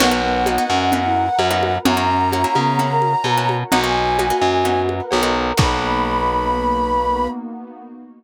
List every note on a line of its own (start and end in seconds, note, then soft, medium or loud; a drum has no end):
0.00 0.58 B1 loud
0.00 0.10 A#3 loud
0.00 0.21 B3 loud
0.00 0.10 B3 loud
0.00 0.10 D#4 loud
0.00 0.10 F#4 loud
0.00 0.92 A#4 medium
0.00 0.92 B4 medium
0.00 0.92 D#5 medium
0.00 1.75 F#5 loud
0.00 0.92 F#5 medium
0.00 crash loud
0.00 cowbell medium
0.00 low conga medium
0.11 0.39 A#3 loud
0.11 0.39 B3 loud
0.11 0.39 D#4 loud
0.11 0.39 F#4 loud
0.23 0.66 B3 loud
0.46 0.56 A#3 loud
0.46 0.56 B3 medium
0.46 0.56 D#4 loud
0.46 0.56 F#4 medium
0.46 cowbell medium
0.46 high conga medium
0.58 0.86 A#3 loud
0.58 0.86 B3 medium
0.58 0.86 D#4 medium
0.58 0.86 F#4 loud
0.70 1.29 F#2 medium
0.70 1.02 C#4 loud
0.92 1.30 A#3 loud
0.92 1.30 B3 loud
0.92 1.30 D#4 loud
0.92 1.30 F#4 loud
0.92 1.85 A#4 medium
0.92 1.85 B4 medium
0.92 1.85 F#5 medium
0.92 1.85 A#5 medium
0.92 cowbell medium
0.92 low conga medium
1.05 1.27 E4 medium
1.39 1.78 F#2 medium
1.39 cowbell medium
1.39 high conga medium
1.51 1.78 A#3 loud
1.51 1.78 B3 loud
1.51 1.78 D#4 loud
1.51 1.78 F#4 medium
1.63 high conga medium
1.85 2.45 F#2 loud
1.85 1.95 A#3 loud
1.85 1.95 C#4 loud
1.85 2.07 C#4 loud
1.85 1.95 E4 loud
1.85 1.95 F#4 loud
1.85 2.78 A#4 loud
1.85 2.78 C#5 medium
1.85 2.78 E5 medium
1.85 2.78 F#5 medium
1.85 3.54 A#5 loud
1.85 cowbell medium
1.85 low conga loud
1.97 2.25 A#3 loud
1.97 2.25 C#4 loud
1.97 2.25 E4 loud
1.97 2.25 F#4 loud
2.09 2.47 C#4 medium
2.32 2.42 A#3 loud
2.32 2.42 C#4 loud
2.32 2.42 E4 loud
2.32 2.42 F#4 loud
2.32 cowbell medium
2.32 high conga medium
2.44 2.72 A#3 loud
2.44 2.72 C#4 loud
2.44 2.72 E4 loud
2.44 2.72 F#4 medium
2.55 3.15 C#3 medium
2.55 2.86 B3 loud
2.55 high conga medium
2.79 3.16 A#3 loud
2.79 3.16 C#4 medium
2.79 3.16 E4 medium
2.79 3.16 F#4 loud
2.79 3.71 A#4 medium
2.79 3.72 C#5 medium
2.79 3.71 F#5 medium
2.79 3.72 A#5 medium
2.79 cowbell medium
2.79 low conga medium
2.91 3.13 A#4 loud
3.02 high conga medium
3.24 3.64 B2 medium
3.24 cowbell medium
3.24 high conga medium
3.37 3.65 A#3 loud
3.37 3.65 C#4 loud
3.37 3.65 E4 loud
3.37 3.65 F#4 loud
3.49 high conga medium
3.70 4.32 B1 loud
3.70 3.81 A#3 loud
3.70 3.81 B3 loud
3.70 3.81 D#4 loud
3.70 3.81 F#4 loud
3.70 4.94 F#4 loud
3.70 4.64 A#4 medium
3.70 4.64 B4 medium
3.70 4.64 D#5 medium
3.70 4.64 F#5 medium
3.70 3.81 A#5 loud
3.70 cowbell medium
3.70 low conga medium
3.84 4.12 A#3 loud
3.84 4.12 B3 loud
3.84 4.12 D#4 medium
3.84 4.12 F#4 medium
3.84 4.80 G#5 loud
4.19 4.28 A#3 loud
4.19 4.28 B3 loud
4.19 4.28 D#4 loud
4.19 4.28 F#4 loud
4.19 cowbell medium
4.19 high conga medium
4.30 4.58 A#3 medium
4.30 4.58 B3 medium
4.30 4.58 D#4 medium
4.30 4.58 F#4 loud
4.41 5.01 F#2 medium
4.65 5.02 A#3 loud
4.65 5.02 B3 medium
4.65 5.02 D#4 loud
4.65 5.02 F#4 loud
4.65 5.57 A#4 medium
4.65 5.57 B4 medium
4.65 5.57 F#5 medium
4.65 5.57 A#5 medium
4.65 cowbell medium
4.65 low conga medium
4.89 high conga medium
5.11 5.52 B1 medium
5.11 cowbell medium
5.11 high conga medium
5.23 5.51 A#3 loud
5.23 5.51 B3 loud
5.23 5.51 D#4 loud
5.23 5.51 F#4 loud
5.57 7.28 B1 loud
5.57 7.27 A#3 loud
5.57 7.28 A#3 loud
5.57 7.27 B3 loud
5.57 7.28 B3 loud
5.57 7.27 D#4 medium
5.57 7.28 D#4 medium
5.57 7.27 F#4 loud
5.57 7.28 F#4 loud
5.57 7.27 B4 loud
5.57 7.28 B5 loud
5.57 kick loud
5.57 crash loud